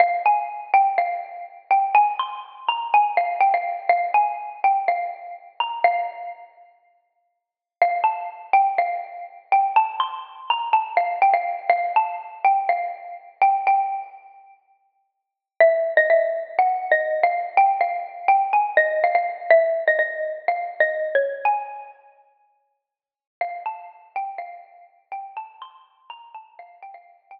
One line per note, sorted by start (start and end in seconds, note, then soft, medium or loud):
0.00 0.22 F5 medium
0.26 0.70 G#5 medium
0.74 0.96 G5 medium
0.98 1.62 F5 medium
1.71 1.94 G5 medium
1.95 2.14 G#5 medium
2.19 2.62 C6 medium
2.68 2.92 A#5 medium
2.94 3.17 G#5 medium
3.17 3.38 F5 medium
3.41 3.52 G5 medium
3.54 3.89 F5 medium
3.89 4.10 F5 medium
4.14 4.58 G#5 medium
4.64 4.85 G5 medium
4.88 5.52 F5 medium
5.60 5.82 A#5 medium
5.84 7.27 F5 medium
7.82 8.01 F5 medium
8.04 8.51 A5 medium
8.53 8.74 G5 medium
8.78 9.41 F5 medium
9.52 9.72 G5 medium
9.76 9.97 A5 medium
10.00 10.45 C6 medium
10.50 10.72 A#5 medium
10.73 10.95 A5 medium
10.97 11.19 F5 medium
11.22 11.33 G5 medium
11.34 11.69 F5 medium
11.70 11.93 F5 medium
11.96 12.39 A5 medium
12.45 12.68 G5 medium
12.69 13.31 F5 medium
13.42 13.64 G5 medium
13.67 14.73 G5 medium
15.60 15.92 E5 medium
15.97 16.09 D#5 medium
16.10 16.52 E5 medium
16.59 16.87 F#5 medium
16.91 17.19 D#5 medium
17.23 17.54 F5 medium
17.57 17.79 G5 medium
17.81 18.24 F5 medium
18.28 18.52 G5 medium
18.53 18.74 G#5 medium
18.77 18.99 D#5 medium
19.04 19.14 F5 medium
19.15 19.45 F5 medium
19.51 19.84 E5 medium
19.88 19.98 D#5 medium
19.99 20.44 D#5 medium
20.48 20.76 F5 medium
20.80 21.08 D#5 medium
21.15 21.46 C#5 medium
21.45 22.24 G#5 medium
23.41 23.63 F5 medium
23.66 24.10 A5 medium
24.16 24.37 G5 medium
24.38 25.06 F5 medium
25.12 25.33 G5 medium
25.37 25.58 A5 medium
25.62 26.04 C6 medium
26.10 26.30 A#5 medium
26.34 26.56 A5 medium
26.59 26.79 F5 medium
26.83 26.94 G5 medium
26.94 27.26 F5 medium
27.31 27.40 G5 medium